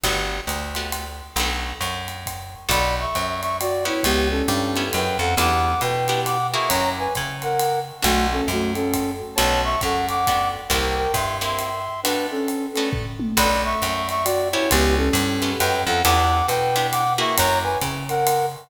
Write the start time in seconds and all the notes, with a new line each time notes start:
0.04 G1 A3 B3 F#4 G4, kick, ride
0.47 D2, hi-hat pedal, ride
0.75 A3 B3 F#4 G4, ride
0.92 ride
1.36 B1 A3 B3 D4 F#4, ride
1.81 F#2, hi-hat pedal, ride
2.08 ride
2.26 kick, ride
2.69 B1 B3 D4 F#4 A4 D5 B5, kick, ride
3.00 E5 C#6
3.15 F#2, hi-hat pedal, ride
3.41 E5 C#6, ride
3.60 F#4 D5, ride
3.85 B3 C#4 E4 G4 C#5
4.03 C#2 B3 G4, kick, ride
4.30 C#4 A4
4.48 G2, hi-hat pedal, ride
4.76 B3 C#4 E4 G4, ride
4.93 F#2 B4 G5, ride
5.19 F2 A4 F#5
5.37 E2 B3 D4 E4 G4 F#5 D6, ride
5.81 B2 B4 G5, hi-hat pedal, ride
6.08 B3 D4 E4 G4, ride
6.25 F#5 D6, ride
6.53 A#3 E4 F#4 G#4 E5 C#6
6.68 F#2 C#5 A#5, kick, ride
6.99 B4 G#5
7.15 C#3, kick, hi-hat pedal, ride
7.42 A#4 F#5, ride
7.59 ride
8.02 B1 A3 B3 D4 F#4, kick, ride
8.32 C#4 A4
8.48 F#2 A3 F#4, hi-hat pedal, ride
8.75 C#4 A4, ride
8.93 kick, ride
9.35 B1 A3 B3 D4 F#4 C#5 A5, ride
9.64 E5 C#6
9.81 F#2 A4 F#5, kick, hi-hat pedal, ride
10.08 F#5 D6, ride
10.27 A3 B3 D4 F#4, kick, ride
10.70 C2 A#3 C4 E4 G4 A#4 G5, kick, ride
10.96 A#4 G5
11.14 G2 E5 C6, kick, hi-hat pedal, ride
11.41 A#3 C4 E4 G4 E5 C6, ride
11.59 ride
12.03 A3 B3 D4 F#4 B4, ride
12.31 C#4 A4
12.48 hi-hat pedal, ride
12.73 A3 B3 C#4 D4 F#4 A4, ride
12.93 kick, floor tom
13.20 high tom
13.37 B1 B3 D4 F#4 A4 D5 B5, kick, ride
13.65 E5 C#6
13.82 F#2, hi-hat pedal, ride
14.09 E5 C#6, ride
14.25 F#4 D5, ride
14.52 B3 C#4 E4 G4 C#5
14.71 C#2 B3 G4, kick, ride
14.97 C#4 A4
15.13 G2, hi-hat pedal, ride
15.42 B3 C#4 E4 G4, ride
15.59 F#2 B4 G5, ride
15.86 F2 A4 F#5
16.04 E2 B3 D4 E4 G4 F#5 D6, ride
16.48 B2 B4 G5, hi-hat pedal, ride
16.76 B3 D4 E4 G4, ride
16.92 F#5 D6, ride
17.18 A#3 E4 F#4 G#4 E5 C#6
17.37 F#2 C#5 A#5, kick, ride
17.63 B4 G#5
17.81 C#3, kick, hi-hat pedal, ride
18.09 A#4 F#5, ride
18.27 ride